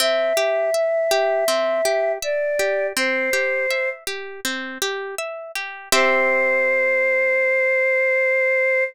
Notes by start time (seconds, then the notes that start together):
0.00 C4 E5
0.37 G4
0.74 E5
1.11 G4
1.48 C4
1.85 G4
2.22 D5 E5
2.59 G4
2.96 C4 C5
3.33 G4
3.71 E5
4.07 G4
4.45 C4
4.82 G4
5.18 E5
5.55 G4
5.92 C4 G4 C5 E5